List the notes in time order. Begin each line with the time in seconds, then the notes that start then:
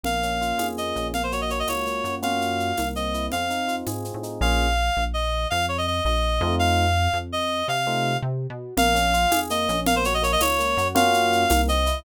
0.03 A#1 A#3 F5, low conga, shaker
0.23 C#4, shaker
0.41 F4, shaker
0.58 F2 G#4, tambourine, high conga, shaker
0.78 A#3 D#5, shaker
0.96 A#1 C#4, shaker
1.14 A#3 F5, low conga, shaker
1.23 C5
1.32 F#4 C#5, shaker
1.41 D#5
1.50 A#3 C#5, shaker
1.59 D#5
1.67 C#2 F4 C#5, tambourine, high conga, shaker
1.86 A#3, shaker
2.04 F#2 F#4, shaker
2.22 A#3 C#4 F4 F#4 F5, low conga, shaker
2.41 shaker
2.60 shaker
2.77 C2 A#3, tambourine, high conga, shaker
2.96 C4 D#5, shaker
3.14 E4, shaker
3.32 F2 C4 F5, low conga, shaker
3.50 D#4, shaker
3.68 F4, shaker
3.87 G#2 G#4, tambourine, high conga, shaker
4.05 C4, shaker
4.14 A2
4.23 D#4, shaker
4.41 A#1 A#3 C#4 F4 G#4 F5
4.97 A#1
5.14 D#5
5.50 F2 F5
5.68 C#5
5.78 D#5
5.87 D#5
6.05 A#1 D#5
6.41 F2 A3 C4 D#4 F4
6.59 F5
7.13 F2
7.32 D#5
7.68 C3 F5
7.87 A3 C4 D#4 F4
8.22 C3
8.50 B2
8.77 A#1 A#3 F5, low conga, shaker
8.95 C#4, shaker
9.13 F4, shaker
9.31 F2 G#4, tambourine, high conga, shaker
9.50 A#3 D#5, shaker
9.69 A#1 C#4, shaker
9.86 A#3 F5, low conga, shaker
9.96 C5
10.04 F#4 C#5, shaker
10.14 D#5
10.22 A#3 C#5, shaker
10.32 D#5
10.40 C#2 F4 C#5, tambourine, high conga, shaker
10.59 A#3, shaker
10.77 F#2 F#4, shaker
10.95 A#3 C#4 F4 F#4 F5, low conga, shaker
11.13 shaker
11.32 shaker
11.50 C2 A#3, tambourine, high conga, shaker
11.68 C4 D#5, shaker
11.86 E4, shaker